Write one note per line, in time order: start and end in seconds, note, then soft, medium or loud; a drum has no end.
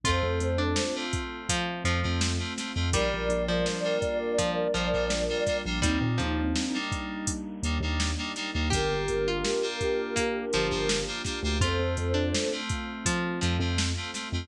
0.03 0.21 F2 medium
0.03 2.90 A3 loud
0.03 0.62 A3 loud
0.03 2.90 C4 medium
0.03 0.62 C4 medium
0.03 2.90 F4 medium
0.03 0.62 F4 medium
0.03 0.52 F4 loud
0.03 0.97 A4 medium
0.03 0.97 C5 medium
0.03 kick loud
0.03 closed hi-hat loud
0.23 0.39 F2 medium
0.40 0.73 F2 medium
0.40 closed hi-hat medium
0.58 1.06 D4 loud
0.76 snare loud
0.95 1.53 A3 medium
0.95 1.53 C4 medium
0.95 1.53 F4 medium
1.13 kick loud
1.13 closed hi-hat medium
1.49 1.84 F3 loud
1.49 kick loud
1.49 closed hi-hat loud
1.84 2.01 F2 medium
1.84 2.46 F3 medium
1.84 2.00 A3 medium
1.84 2.00 C4 medium
1.84 2.00 F4 medium
1.84 closed hi-hat medium
2.03 2.37 F2 medium
2.03 2.32 A3 medium
2.03 2.32 C4 loud
2.03 2.32 F4 medium
2.21 snare loud
2.39 2.54 A3 medium
2.39 2.54 C4 medium
2.39 2.54 F4 medium
2.58 2.72 A3 medium
2.58 2.72 C4 medium
2.58 2.72 F4 medium
2.58 snare medium
2.58 closed hi-hat medium
2.75 2.92 F2 medium
2.75 2.90 A3 medium
2.75 2.90 C4 medium
2.75 2.90 F4 medium
2.93 3.09 A#1 medium
2.93 5.80 G3 loud
2.93 3.43 G3 loud
2.93 3.52 G3 loud
2.93 5.80 A#3 loud
2.93 3.52 A#3 medium
2.93 5.80 D4 loud
2.93 3.52 D4 loud
2.93 5.80 F4 medium
2.93 3.52 F4 loud
2.93 5.58 A#4 medium
2.93 5.58 D5 medium
2.93 kick loud
2.93 closed hi-hat loud
3.14 3.29 A#1 medium
3.29 3.62 A#1 medium
3.29 closed hi-hat medium
3.48 3.98 F3 loud
3.66 snare loud
3.84 4.42 G3 medium
3.84 4.42 A#3 medium
3.84 4.42 D4 medium
3.84 4.42 F4 medium
4.02 kick loud
4.02 closed hi-hat medium
4.38 4.68 F3 loud
4.38 kick loud
4.38 closed hi-hat loud
4.74 4.91 A#1 medium
4.74 5.42 F3 loud
4.74 4.89 G3 medium
4.74 4.89 A#3 medium
4.74 4.89 D4 medium
4.74 4.89 F4 medium
4.74 closed hi-hat medium
4.93 5.27 A#1 medium
4.93 5.22 G3 medium
4.93 5.22 A#3 medium
4.93 5.22 D4 medium
4.93 5.22 F4 medium
5.10 snare loud
5.29 5.44 G3 medium
5.29 5.44 A#3 medium
5.29 5.44 D4 medium
5.29 5.44 F4 medium
5.47 5.62 G3 medium
5.47 5.62 A#3 medium
5.47 5.62 D4 medium
5.47 5.62 F4 medium
5.47 kick loud
5.47 snare medium
5.47 closed hi-hat medium
5.66 5.82 A#1 medium
5.66 5.80 G3 medium
5.66 5.80 A#3 medium
5.66 5.80 D4 medium
5.66 5.80 F4 medium
5.82 5.99 D#2 medium
5.82 5.99 G3 loud
5.82 8.69 G3 loud
5.82 6.41 G3 medium
5.82 8.69 A#3 medium
5.82 6.41 A#3 loud
5.82 6.77 C4 medium
5.82 8.69 D4 loud
5.82 6.41 D4 medium
5.82 8.69 D#4 loud
5.82 6.77 D#4 loud
5.82 6.41 D#4 medium
5.82 kick loud
5.82 closed hi-hat loud
6.01 6.17 A#2 medium
6.18 6.53 D#2 medium
6.18 6.79 F3 medium
6.18 closed hi-hat medium
6.56 snare loud
6.74 7.32 G3 medium
6.74 7.32 A#3 medium
6.74 7.32 D4 medium
6.74 7.32 D#4 medium
6.92 kick loud
6.92 closed hi-hat medium
7.27 kick loud
7.27 closed hi-hat loud
7.63 7.79 D#2 medium
7.63 7.78 G3 medium
7.63 7.78 A#3 medium
7.63 7.78 D4 medium
7.63 7.78 D#4 medium
7.63 closed hi-hat loud
7.80 8.13 D#2 medium
7.80 8.11 G3 medium
7.80 8.11 A#3 medium
7.80 8.11 D4 medium
7.80 8.11 D#4 medium
8.00 snare loud
8.18 8.33 G3 medium
8.18 8.33 A#3 medium
8.18 8.33 D4 medium
8.18 8.33 D#4 medium
8.36 8.51 G3 medium
8.36 8.51 A#3 medium
8.36 8.51 D4 medium
8.36 8.51 D#4 medium
8.36 snare medium
8.36 closed hi-hat medium
8.54 8.71 D#2 medium
8.54 8.69 G3 medium
8.54 8.69 A#3 medium
8.54 8.69 D4 medium
8.54 8.69 D#4 medium
8.70 8.90 G1 medium
8.70 9.30 A#3 medium
8.70 11.59 A#3 medium
8.70 9.30 D4 loud
8.70 11.59 D4 loud
8.70 9.30 F4 medium
8.70 11.59 F4 medium
8.70 9.19 G4 loud
8.70 9.30 G4 loud
8.70 11.59 G4 loud
8.70 11.05 G4 medium
8.70 11.05 A#4 medium
8.70 kick loud
8.70 closed hi-hat loud
8.91 9.07 G1 medium
9.08 9.42 G1 medium
9.08 closed hi-hat medium
9.28 9.79 F4 medium
9.45 snare loud
9.62 10.20 A#3 medium
9.62 10.20 D4 medium
9.62 10.20 F4 medium
9.62 10.20 G4 medium
9.81 kick medium
9.81 closed hi-hat medium
10.16 10.45 A#3 medium
10.16 kick medium
10.16 closed hi-hat loud
10.53 10.71 G1 medium
10.53 11.24 F3 loud
10.53 10.67 A#3 medium
10.53 10.67 D4 medium
10.53 10.67 F4 medium
10.53 10.67 G4 medium
10.53 closed hi-hat medium
10.70 11.05 G1 medium
10.70 10.99 A#3 medium
10.70 10.99 D4 medium
10.70 10.99 F4 medium
10.70 10.99 G4 medium
10.89 snare loud
11.07 11.22 A#3 medium
11.07 11.22 D4 medium
11.07 11.22 F4 medium
11.07 11.22 G4 medium
11.25 11.40 A#3 medium
11.25 11.40 D4 medium
11.25 11.40 F4 medium
11.25 11.40 G4 medium
11.25 kick medium
11.25 snare medium
11.25 closed hi-hat medium
11.43 11.59 D2 medium
11.43 11.58 A#3 medium
11.43 11.58 D4 medium
11.43 11.58 F4 medium
11.43 11.58 G4 medium
11.61 11.78 F2 medium
11.61 14.47 A3 loud
11.61 12.19 A3 loud
11.61 14.47 C4 medium
11.61 12.19 C4 medium
11.61 14.47 F4 medium
11.61 12.08 F4 loud
11.61 12.19 F4 medium
11.61 12.53 A4 medium
11.61 12.53 C5 medium
11.61 kick loud
11.61 closed hi-hat loud
11.79 11.95 F2 medium
11.97 12.30 F2 medium
11.97 closed hi-hat medium
12.14 12.61 D4 loud
12.34 snare loud
12.52 13.10 A3 medium
12.52 13.10 C4 medium
12.52 13.10 F4 medium
12.69 kick loud
12.69 closed hi-hat medium
13.06 13.40 F3 loud
13.06 kick loud
13.06 closed hi-hat loud
13.41 13.59 F2 medium
13.41 14.02 F3 medium
13.41 13.57 A3 medium
13.41 13.57 C4 medium
13.41 13.57 F4 medium
13.41 closed hi-hat medium
13.60 13.92 F2 medium
13.60 13.89 A3 medium
13.60 13.89 C4 loud
13.60 13.89 F4 medium
13.78 snare loud
13.97 14.11 A3 medium
13.97 14.11 C4 medium
13.97 14.11 F4 medium
14.14 14.29 A3 medium
14.14 14.29 C4 medium
14.14 14.29 F4 medium
14.14 snare medium
14.14 closed hi-hat medium
14.33 14.48 F2 medium
14.33 14.47 A3 medium
14.33 14.47 C4 medium
14.33 14.47 F4 medium